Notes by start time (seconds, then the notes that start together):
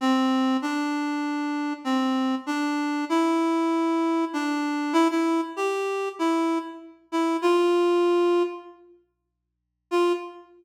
0.01 C4
0.62 D4
1.84 C4
2.46 D4
3.09 E4
4.33 D4
4.93 E4
5.11 E4
5.56 G4
6.19 E4
7.12 E4
7.42 F4
9.91 F4